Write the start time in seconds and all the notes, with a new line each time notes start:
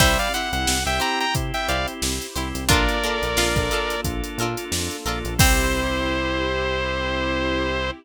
0.00 C2 G3 C4 E4 G4 C5 E5, kick, crash
0.19 D5 F5, closed hi-hat
0.34 C4 E4 G4 C5 F#5, closed hi-hat
0.53 C2 C4 E4 G4 F#5, snare, closed hi-hat
0.67 C2, snare
0.86 C2 C4 E4 G4 E5 G5, closed hi-hat
1.00 E4 G4 C5 G5 A#5, closed hi-hat
1.20 G5 A#5, closed hi-hat
1.35 C3 C4 E4 G4, kick, closed hi-hat
1.54 E5 G5, snare, closed hi-hat
1.68 C2 E4 G4 C5 D5 F5, closed hi-hat
1.87 C4 E4 G4, closed hi-hat
2.02 C2, snare
2.21 snare, closed hi-hat
2.36 C2 C4 E4 G4 C5, snare, closed hi-hat
2.55 C2, snare, closed hi-hat
2.69 A#1 A#3 D4 F4 A4 A#4 D5, kick, closed hi-hat
2.73 D4
2.89 closed hi-hat
3.03 A#3 D4 F4 A4 A#4, closed hi-hat
3.22 A#1 A#3 D4 F4 A4, closed hi-hat
3.37 A#1 F4, snare
3.56 A#1 A#3 D4 F4 A4, kick, closed hi-hat
3.71 D4 F4 A4 A#4, closed hi-hat
3.90 closed hi-hat
4.04 A#1 A#3 D4 F4 A4, kick, closed hi-hat
4.24 closed hi-hat
4.38 A#2 F4 A4 A#4, closed hi-hat
4.43 D4
4.57 A#3 D4 F4 A4, closed hi-hat
4.72 F2, snare
4.91 closed hi-hat
5.05 A#1 A#3 D4 F4 A4 A#4, closed hi-hat
5.24 A#1, closed hi-hat
5.38 C2 C4 E4 G4 C5, kick, crash